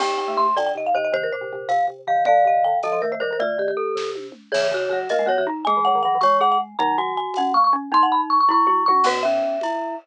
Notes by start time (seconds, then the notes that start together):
0.00 D#2 C4 G4 G5, crash, low conga
0.18 G5
0.28 A3
0.37 A3 C6
0.56 D2 D3 D5 G5, tambourine, high conga
0.66 G5
0.75 D#2 C3 D#5
0.86 F5
0.94 D#2 C3 C5 D#5
1.04 D#5
1.12 C3 D#3 C5, low conga
1.23 A#4
1.32 A#2 C5
1.41 C3
1.53 C3
1.69 C3 F5, tambourine, high conga
1.88 C3
2.07 C3 D#3 F5
2.17 D#3
2.25 D3 D5 F5, low conga
2.45 C3 D#5
2.64 D3 G5
2.83 D3 F3 A4 D#5, tambourine, high conga
2.92 F3 D#5
3.02 D#3 A3 A#4
3.12 A3 C5
3.20 D#3 G3 A#4 C5
3.31 D#3 A#4
3.40 D3 A3 F4 D5, low conga
3.58 D#3 G4
3.68 G4
3.77 A4
3.95 C3, kick, snare
4.15 high tom
4.32 mid tom
4.52 C#3 E3 G#4 C#5, crash, low conga
4.71 C#3 F#4
4.89 C#3 F#3 F#4
5.09 A#3 A#4 D#5, tambourine, high conga
5.19 G#3
5.26 F#3 B3 F#4 C#5
5.37 E3 F#4
5.47 D#4
5.65 G#3 G#4 G#5, low conga
5.77 E3
5.85 F#3 F#5
5.95 D#3
6.03 E3 F#3 F#5
6.15 E3
6.21 G#3 C#5 C#6, tambourine, high conga
6.41 G#4 F#5
6.52 F#5
6.79 D#3 F#3 D#4 A#5, low conga
6.98 F#4 G#5
7.17 G#5
7.34 F#5, tambourine, high conga
7.38 C#4
7.54 A#3 C#6
7.64 C#6
7.73 C#4
7.92 C4 D#4 C6, low conga
8.03 F#5
8.12 B5
8.30 C#6
8.40 C#6
8.49 E4 C#6, kick, floor tom
8.67 E4 F#4, mid tom
8.86 F#3 F#4 C#6, high tom
9.04 B2 B3 F#4 B4, crash, low conga
9.23 C#4 E5
9.61 E4, tambourine, high conga